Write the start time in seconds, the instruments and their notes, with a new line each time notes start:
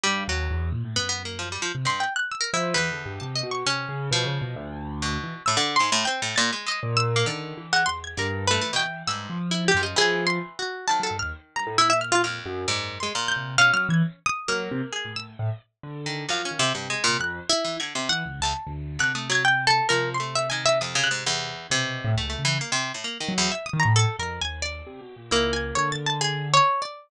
0.03 acoustic grand piano G2, harpsichord G3
0.28 acoustic grand piano D#2, harpsichord F#3
0.51 acoustic grand piano E2
0.72 acoustic grand piano A#2
0.84 acoustic grand piano A2
0.96 acoustic grand piano F#2, harpsichord B3
1.09 harpsichord B3
1.25 harpsichord A#3
1.39 harpsichord F3
1.52 harpsichord G3
1.62 harpsichord F3
1.75 acoustic grand piano C3
1.85 harpsichord G2, pizzicato strings C6
2.00 pizzicato strings G5
2.16 pizzicato strings F#6
2.31 pizzicato strings E6
2.41 pizzicato strings A#4
2.53 acoustic grand piano F3, pizzicato strings E4
2.74 harpsichord E2, acoustic grand piano E3, pizzicato strings B4
2.91 acoustic grand piano D3
3.06 acoustic grand piano G2
3.20 acoustic grand piano C3, pizzicato strings A5
3.36 pizzicato strings D#5
3.43 acoustic grand piano B2
3.51 pizzicato strings C#6
3.66 acoustic grand piano C3, harpsichord C#4
3.89 acoustic grand piano C#3
4.11 acoustic grand piano B2, harpsichord F3
4.25 acoustic grand piano C#3
4.41 acoustic grand piano B2
4.56 acoustic grand piano D2
5.02 harpsichord B2
5.23 acoustic grand piano E3
5.46 harpsichord A2, pizzicato strings E6
5.57 harpsichord D3
5.76 pizzicato strings C6
5.80 harpsichord G#2
5.92 harpsichord A2
6.05 harpsichord C4, pizzicato strings G5
6.22 harpsichord A2
6.36 harpsichord A#2, pizzicato strings A6
6.53 harpsichord G#3
6.66 harpsichord G#3, pizzicato strings D#5
6.83 acoustic grand piano A#2
6.97 pizzicato strings E6
7.16 harpsichord A#3
7.26 harpsichord D3, acoustic grand piano D#3, pizzicato strings D5
7.57 acoustic grand piano E3
7.73 harpsichord G#3, pizzicato strings F#5
7.86 acoustic grand piano E2, pizzicato strings C6
8.04 pizzicato strings G#6
8.17 acoustic grand piano G2, harpsichord D3, pizzicato strings A#4
8.47 harpsichord A3, pizzicato strings B4
8.61 acoustic grand piano E3, harpsichord A3
8.73 harpsichord B2, pizzicato strings G5
9.07 harpsichord G2, acoustic grand piano G#2, pizzicato strings E6
9.30 acoustic grand piano F3
9.51 pizzicato strings E4
9.68 pizzicato strings G4
9.74 acoustic grand piano F#2, harpsichord F3
9.83 pizzicato strings D#5
9.96 harpsichord E3, acoustic grand piano F3, pizzicato strings G#4
10.27 pizzicato strings C6
10.59 pizzicato strings F#4
10.87 harpsichord D#3, acoustic grand piano F#3, pizzicato strings A5
11.00 acoustic grand piano F#3, pizzicato strings A4
11.11 acoustic grand piano G2
11.19 acoustic grand piano D#2, pizzicato strings F6
11.56 acoustic grand piano G2, pizzicato strings A#5
11.67 acoustic grand piano A2
11.78 acoustic grand piano A#2, pizzicato strings E4
11.90 pizzicato strings E5
12.01 pizzicato strings F6
12.12 pizzicato strings F4
12.24 harpsichord F2, pizzicato strings F6
12.46 acoustic grand piano F#2
12.68 acoustic grand piano F#2, harpsichord G#2, pizzicato strings D5
13.00 harpsichord G#3, pizzicato strings C6
13.15 harpsichord A#2
13.28 pizzicato strings G6
13.36 acoustic grand piano C3
13.58 acoustic grand piano B2, harpsichord C#4, pizzicato strings F5
13.73 acoustic grand piano F#3, pizzicato strings F6
13.89 acoustic grand piano E3, pizzicato strings G#6
14.26 pizzicato strings D#6
14.48 acoustic grand piano F#3, harpsichord A#3, pizzicato strings F6
14.71 acoustic grand piano C3
14.92 pizzicato strings G#4
15.05 acoustic grand piano A2
15.16 pizzicato strings E6
15.39 acoustic grand piano A2
15.83 acoustic grand piano D3
16.06 harpsichord D#3
16.29 harpsichord F#2, acoustic grand piano F3, pizzicato strings F5
16.45 harpsichord C#4
16.51 acoustic grand piano D#3
16.59 harpsichord C3
16.75 harpsichord G2, acoustic grand piano C3
16.90 harpsichord G#3
17.04 harpsichord A#2
17.08 acoustic grand piano C3
17.19 acoustic grand piano F2, pizzicato strings F#6
17.49 pizzicato strings E4
17.64 harpsichord E3
17.80 harpsichord D3, pizzicato strings G#6
17.95 harpsichord C3
18.09 acoustic grand piano E3, pizzicato strings F#5
18.25 acoustic grand piano C#2
18.40 acoustic grand piano C#2, harpsichord E2, pizzicato strings A5
18.67 acoustic grand piano D2
18.99 acoustic grand piano C3, harpsichord D3, pizzicato strings F#6
19.15 harpsichord A3, pizzicato strings D#6
19.30 harpsichord F#3, pizzicato strings G#6
19.45 pizzicato strings G5
19.67 pizzicato strings A4
19.89 acoustic grand piano C3, harpsichord F3, pizzicato strings A#4
20.14 pizzicato strings C6
20.20 harpsichord A3
20.35 pizzicato strings E5
20.50 harpsichord D#3, pizzicato strings G#5
20.66 pizzicato strings E5
20.81 harpsichord F2, pizzicato strings D#6
20.95 harpsichord C#3
21.04 pizzicato strings F#6
21.11 harpsichord G#2
21.26 harpsichord E2
21.70 acoustic grand piano B2, harpsichord C3
22.05 acoustic grand piano A2
22.15 acoustic grand piano C#2, harpsichord A3
22.30 harpsichord A3
22.39 acoustic grand piano C#3
22.45 harpsichord E3
22.61 harpsichord A#3
22.72 harpsichord C3
22.94 harpsichord A2
23.04 harpsichord A#3
23.20 harpsichord D#3
23.28 acoustic grand piano F#3
23.38 harpsichord E2
23.52 pizzicato strings E5
23.66 pizzicato strings D#6
23.73 acoustic grand piano D#3
23.80 pizzicato strings A#5
23.85 acoustic grand piano A2
23.96 pizzicato strings A4
24.19 acoustic grand piano F2, pizzicato strings A#4
24.41 acoustic grand piano D#2, pizzicato strings G#5
24.62 pizzicato strings D5
24.87 acoustic grand piano C3
25.01 acoustic grand piano B2
25.16 acoustic grand piano A#2
25.31 acoustic grand piano C#2, harpsichord A#3, pizzicato strings E4
25.53 pizzicato strings G#5
25.75 acoustic grand piano D3, pizzicato strings C#5
25.92 pizzicato strings A6
26.06 pizzicato strings A5
26.21 pizzicato strings G#4
26.54 pizzicato strings C#5
26.82 pizzicato strings D5